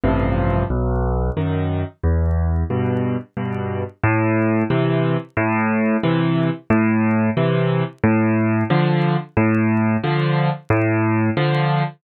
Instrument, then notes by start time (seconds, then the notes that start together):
acoustic grand piano
0.04 A1 G2 C3 F3
0.70 B1
1.37 F#2 D#3
2.03 E2
2.70 G2 B2
3.37 G2 B2
4.03 A2
4.70 C3 E3
5.37 A2
6.03 C3 E3
6.70 A2
7.37 C3 E3
8.04 A2
8.70 D3 F3
9.37 A2
10.03 D3 F3
10.70 A2
11.37 D3 F3